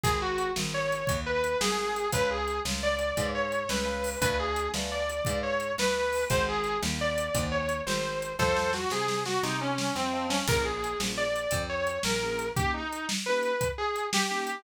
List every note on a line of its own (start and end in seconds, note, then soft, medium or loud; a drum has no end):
0.03 0.51 G#1 loud
0.03 0.18 G#4 loud
0.03 kick medium
0.03 closed hi-hat medium
0.22 0.51 F#4 medium
0.38 closed hi-hat medium
0.56 1.03 G#1 medium
0.56 snare medium
0.74 1.17 C#5 medium
0.92 closed hi-hat medium
1.07 1.55 D#2 medium
1.07 kick medium
1.07 closed hi-hat medium
1.26 1.58 B4 loud
1.44 closed hi-hat medium
1.61 2.08 G#1 medium
1.61 2.08 G#4 loud
1.61 snare loud
1.96 closed hi-hat medium
2.12 2.60 C#2 loud
2.12 2.37 B4 medium
2.12 2.30 B4 loud
2.12 2.37 C#5 medium
2.12 2.37 F5 medium
2.12 2.37 G#5 medium
2.12 kick medium
2.12 closed hi-hat loud
2.31 2.60 G#4 medium
2.48 closed hi-hat medium
2.65 3.12 C#2 medium
2.65 snare medium
2.83 3.29 D5 medium
2.99 closed hi-hat medium
3.17 3.64 G#2 medium
3.17 3.42 B4 medium
3.17 3.42 C#5 medium
3.17 3.42 F5 medium
3.17 3.42 G#5 medium
3.17 kick medium
3.17 closed hi-hat medium
3.35 3.68 C#5 medium
3.52 closed hi-hat medium
3.69 4.16 C#2 medium
3.69 4.18 B4 medium
3.69 snare medium
3.85 4.09 B4 medium
3.85 4.09 C#5 medium
3.85 4.09 F5 medium
3.85 4.09 G#5 medium
4.04 open hi-hat medium
4.21 4.69 D2 loud
4.21 4.36 B4 loud
4.21 4.46 B4 medium
4.21 4.46 D5 medium
4.21 4.46 F5 medium
4.21 4.46 G#5 medium
4.21 kick medium
4.21 closed hi-hat loud
4.39 4.69 G#4 loud
4.56 closed hi-hat medium
4.74 5.21 D2 medium
4.74 4.99 B4 medium
4.74 4.99 D5 medium
4.74 4.99 F5 medium
4.74 4.99 G#5 medium
4.74 snare medium
4.92 5.38 D5 medium
5.09 closed hi-hat medium
5.25 5.73 G#2 medium
5.25 5.51 B4 medium
5.25 5.51 D5 medium
5.25 5.51 F5 medium
5.25 5.51 G#5 medium
5.25 kick medium
5.25 closed hi-hat medium
5.43 5.72 C#5 medium
5.60 closed hi-hat medium
5.78 6.25 D2 medium
5.78 6.24 B4 loud
5.78 snare loud
6.12 open hi-hat medium
6.30 6.77 G#1 loud
6.30 6.54 C5 medium
6.30 6.46 C5 loud
6.30 6.54 D#5 medium
6.30 6.54 F#5 medium
6.30 6.54 G#5 medium
6.30 kick medium
6.30 closed hi-hat medium
6.48 6.78 G#4 loud
6.64 closed hi-hat medium
6.82 7.29 D#2 loud
6.82 snare medium
7.01 7.44 D5 medium
7.18 closed hi-hat medium
7.34 7.82 D#2 loud
7.34 7.59 C5 medium
7.34 7.59 D#5 medium
7.34 7.59 F#5 medium
7.34 7.59 G#5 medium
7.34 kick medium
7.34 closed hi-hat loud
7.52 7.81 C#5 medium
7.69 closed hi-hat medium
7.86 8.34 G#1 medium
7.86 8.32 C5 medium
7.86 snare medium
8.22 closed hi-hat medium
8.39 8.86 F2 medium
8.39 8.71 A4 loud
8.39 8.63 C5 medium
8.39 8.71 C5 loud
8.39 8.63 D#5 medium
8.39 8.63 F5 medium
8.39 8.63 A5 medium
8.39 kick medium
8.39 snare medium
8.56 snare medium
8.73 8.88 F#4 loud
8.73 snare medium
8.90 9.38 C3 medium
8.90 9.20 G#4 loud
8.90 snare medium
9.08 snare medium
9.25 9.42 F#4 medium
9.25 snare medium
9.43 9.90 C3 loud
9.43 9.60 D#4 medium
9.43 snare medium
9.61 9.93 C#4 medium
9.78 snare medium
9.95 10.42 F2 medium
9.95 10.26 C4 medium
9.95 snare medium
10.13 10.37 C5 medium
10.13 10.37 D#5 medium
10.13 10.37 F5 medium
10.13 10.37 A5 medium
10.29 10.43 C#4 medium
10.29 snare medium
10.48 10.95 A#1 loud
10.48 10.72 A#3 medium
10.48 10.72 C#4 medium
10.48 10.72 F4 medium
10.48 10.72 G#4 medium
10.48 10.63 A#4 loud
10.48 kick loud
10.48 crash medium
10.65 10.98 G#4 medium
10.84 closed hi-hat medium
11.00 11.47 A#1 medium
11.00 11.25 A#3 medium
11.00 11.25 C#4 medium
11.00 11.25 F4 medium
11.00 11.25 G#4 medium
11.00 snare medium
11.17 11.62 D5 medium
11.36 closed hi-hat medium
11.51 11.99 F2 loud
11.51 kick medium
11.51 closed hi-hat medium
11.69 11.99 C#5 medium
11.87 closed hi-hat medium
12.03 12.51 A#1 medium
12.03 12.48 A#4 medium
12.03 snare loud
12.22 12.46 A#3 medium
12.22 12.46 C#4 medium
12.22 12.46 F4 medium
12.22 12.46 G#4 medium
12.39 closed hi-hat medium
12.56 12.81 A#3 medium
12.56 12.81 C#4 medium
12.56 12.81 D#4 medium
12.56 12.71 G4 loud
12.56 12.81 G4 medium
12.56 kick medium
12.56 closed hi-hat medium
12.74 13.06 D#4 medium
12.93 closed hi-hat medium
13.09 snare loud
13.26 13.52 A#3 medium
13.26 13.52 C#4 medium
13.26 13.52 D#4 medium
13.26 13.52 G4 medium
13.26 13.68 B4 loud
13.43 closed hi-hat medium
13.61 kick medium
13.61 closed hi-hat medium
13.78 14.06 G#4 medium
13.96 closed hi-hat medium
14.13 14.61 G4 loud
14.13 snare loud
14.31 14.55 A#3 medium
14.31 14.55 C#4 medium
14.31 14.55 D#4 medium
14.31 14.55 G4 medium
14.47 closed hi-hat medium